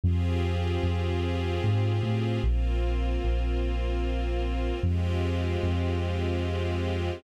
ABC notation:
X:1
M:3/4
L:1/8
Q:1/4=75
K:Cm
V:1 name="String Ensemble 1"
[CFGA]6 | [B,CF]6 | [A,CFG]6 |]
V:2 name="Synth Bass 2" clef=bass
F,,2 F,,2 A,, =A,, | B,,,2 B,,,4 | F,,2 F,,4 |]